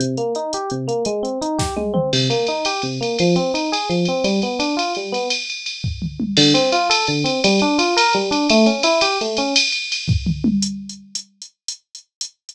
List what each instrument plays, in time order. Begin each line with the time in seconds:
0.00 electric piano 1 C3, closed hi-hat
0.17 electric piano 1 A#3, closed hi-hat
0.35 electric piano 1 D#4, closed hi-hat
0.53 electric piano 1 G4, closed hi-hat
0.70 electric piano 1 C3, closed hi-hat
0.88 electric piano 1 A#3, closed hi-hat
1.05 electric piano 1 G#3, closed hi-hat
1.23 electric piano 1 C4, closed hi-hat
1.41 electric piano 1 D#4, closed hi-hat
1.58 electric piano 1 G4, kick, snare
1.76 electric piano 1 G#3, high tom
1.94 electric piano 1 C4, mid tom
2.13 electric piano 1 C3, crash
2.30 electric piano 1 A#3, ride
2.47 electric piano 1 D#4, ride
2.65 electric piano 1 G4, ride
2.82 electric piano 1 C3, ride
3.01 electric piano 1 A#3, ride
3.19 electric piano 1 F3, ride
3.36 electric piano 1 C4, ride
3.54 electric piano 1 D#4, ride
3.72 electric piano 1 G#4, ride
3.89 electric piano 1 F3, ride
4.05 electric piano 1 C4, ride
4.24 electric piano 1 G3, ride
4.42 electric piano 1 B3, ride
4.59 electric piano 1 D4, ride
4.77 electric piano 1 F4, ride
4.95 electric piano 1 G3, ride
5.12 electric piano 1 B3, ride
5.30 ride
5.50 ride
5.66 ride
5.84 kick, floor tom
6.02 mid tom
6.20 high tom
6.37 electric piano 1 D3, crash
6.54 electric piano 1 C4, ride
6.72 electric piano 1 F4, ride
6.90 electric piano 1 A4, ride
7.07 electric piano 1 D3, ride
7.24 electric piano 1 C4, ride
7.44 electric piano 1 G3, ride
7.59 electric piano 1 D4, ride
7.78 electric piano 1 F4, ride
7.97 electric piano 1 A#4, ride
8.13 electric piano 1 G3, ride
8.31 electric piano 1 D4, ride
8.50 electric piano 1 A3, ride
8.66 electric piano 1 C#4, ride
8.83 electric piano 1 E4, ride
9.01 electric piano 1 G4, ride
9.21 electric piano 1 A3, ride
9.37 electric piano 1 C#4, ride
9.56 ride
9.72 ride
9.92 ride
10.08 kick, floor tom
10.26 mid tom
10.44 high tom
10.62 closed hi-hat
10.89 closed hi-hat
11.15 closed hi-hat
11.42 closed hi-hat
11.68 closed hi-hat
11.95 closed hi-hat
12.21 closed hi-hat
12.49 closed hi-hat